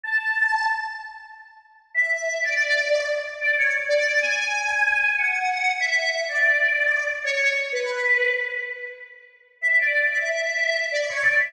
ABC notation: X:1
M:3/4
L:1/16
Q:1/4=94
K:A
V:1 name="Choir Aahs"
a4 z8 | e e2 d5 z d c z | d2 g6 f4 | e e2 d5 z c c z |
B4 z8 | e d2 e5 d c d e |]